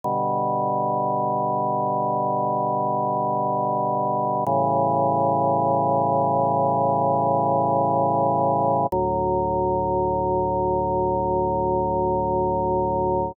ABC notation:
X:1
M:4/4
L:1/8
Q:1/4=54
K:D
V:1 name="Drawbar Organ" clef=bass
[B,,D,G,]8 | [A,,C,E,G,]8 | [D,,A,,F,]8 |]